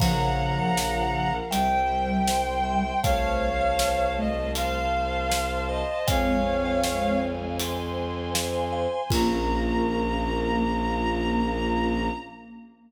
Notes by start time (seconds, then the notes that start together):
0.00 A#1 C#3 F3 A#4 C#5 F5 F#5 A#5, kick, crash
0.58 C#5 F5 A#5
0.76 F4 A#4 F5, snare
1.51 C2 G3 C5 E5 G5, closed hi-hat
2.28 C5 E5 G5 C6, snare
2.64 C5 E5 G5
3.03 C2 A3 C5 C#5 F5 A5, kick, closed hi-hat
3.61 C5 F5 A5
3.79 snare
4.17 A3 D#5
4.55 C5 F5 A5 C6, closed hi-hat
5.30 C5 F5 A5, snare
5.68 C5 D#5 F5 A5
6.07 F2 G#3 C4 C5 C#5 F5 G#5, kick, closed hi-hat
6.65 C5 F5 G#5
6.84 snare
7.59 C5 G#5 C6, closed hi-hat
8.34 C5 F5 G#5, snare
8.72 C5 F5 G#5
9.10 A#1 A#3 C#4 F4 A#4 A#5, kick, crash